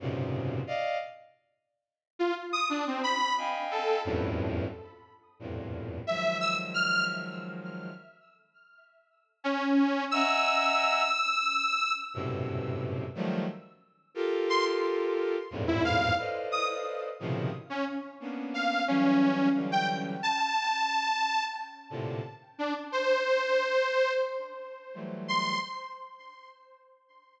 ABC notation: X:1
M:6/8
L:1/16
Q:3/8=59
K:none
V:1 name="Violin"
[^F,,^G,,^A,,B,,C,^C,]4 [d^d=f]2 z6 | z8 [^dfg^g]4 | [E,,F,,^F,,G,,A,,]4 z4 [E,,=F,,G,,A,,^A,,]4 | [^D,F,^F,^G,]12 |
z12 | [^de^f^g^a]6 z6 | [^F,,G,,A,,B,,C,]6 [^D,=F,^F,G,A,]2 z4 | [FGA^A]8 [E,,F,,G,,^G,,=A,,^A,,]4 |
[ABcd^d]6 [A,,B,,C,^C,^D,F,]2 z4 | [^A,B,^CD]4 [E,^F,G,]4 [D,E,F,G,]4 | z10 [A,,^A,,C,D,]2 | z12 |
z4 [E,^F,G,A,]4 z4 |]
V:2 name="Lead 2 (sawtooth)"
z12 | z F z ^d' =D C b2 z2 A2 | z12 | e2 e' z f'2 z6 |
z8 ^C4 | e'12 | z12 | z2 c' z6 E f2 |
z2 ^d' z6 ^C z2 | z2 f2 ^C4 z g z2 | a8 z4 | z2 D z c8 |
z6 c'2 z4 |]